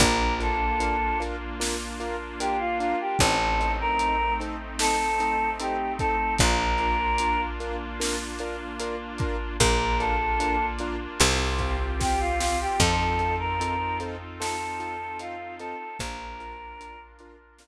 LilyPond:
<<
  \new Staff \with { instrumentName = "Choir Aahs" } { \time 4/4 \key bes \major \tempo 4 = 75 bes'8 a'4 r4. g'16 f'16 f'16 g'16 | a'8. bes'8. r8 a'4 g'8 a'8 | bes'4. r2 r8 | bes'8 a'4 r4. g'16 f'16 f'16 g'16 |
a'8. bes'8. r8 a'4 f'8 a'8 | bes'4. r2 r8 | }
  \new Staff \with { instrumentName = "Acoustic Grand Piano" } { \time 4/4 \key bes \major <d' f' bes'>8 <d' f' bes'>8 <d' f' bes'>8 <d' f' bes'>8 <d' f' bes'>8 <d' f' bes'>8 <d' f' bes'>8 <d' f' bes'>8 | <c' ees' a'>8 <c' ees' a'>8 <c' ees' a'>8 <c' ees' a'>8 <c' ees' a'>8 <c' ees' a'>8 <c' ees' a'>8 <c' ees' a'>8 | <d' f' bes'>8 <d' f' bes'>8 <d' f' bes'>8 <d' f' bes'>8 <d' f' bes'>8 <d' f' bes'>8 <d' f' bes'>8 <d' f' bes'>8 | <d' f' bes'>8 <d' f' bes'>8 <d' f' bes'>8 <d' f' bes'>8 <c' f' g'>8 <c' f' g'>8 <c' f' g'>8 <c' f' g'>8 |
<c' ees' f' a'>8 <c' ees' f' a'>8 <c' ees' f' a'>8 <c' ees' f' a'>8 <c' ees' f' a'>8 <c' ees' f' a'>8 <c' ees' f' a'>8 <c' ees' f' a'>8 | <d' f' bes'>8 <d' f' bes'>8 <d' f' bes'>8 <d' f' bes'>8 <d' f' bes'>8 r4. | }
  \new Staff \with { instrumentName = "Electric Bass (finger)" } { \clef bass \time 4/4 \key bes \major bes,,1 | a,,1 | bes,,1 | bes,,2 c,2 |
f,1 | bes,,1 | }
  \new Staff \with { instrumentName = "Brass Section" } { \time 4/4 \key bes \major <bes d' f'>1 | <a c' ees'>1 | <bes d' f'>1 | <bes d' f'>2 <c' f' g'>2 |
<c' ees' f' a'>1 | <d' f' bes'>1 | }
  \new DrumStaff \with { instrumentName = "Drums" } \drummode { \time 4/4 <hh bd>8 hh8 hh8 hh8 sn8 hh8 hh8 hh8 | <hh bd>8 hh8 hh8 hh8 sn8 hh8 hh8 <hh bd>8 | <hh bd>8 hh8 hh8 hh8 sn8 hh8 hh8 <hh bd>8 | <hh bd>8 hh8 hh8 hh8 sn8 <hh bd>8 <bd sn>8 sn8 |
<cymc bd>8 hh8 hh8 hh8 sn8 hh8 hh8 hh8 | <hh bd>8 hh8 hh8 hh8 sn4 r4 | }
>>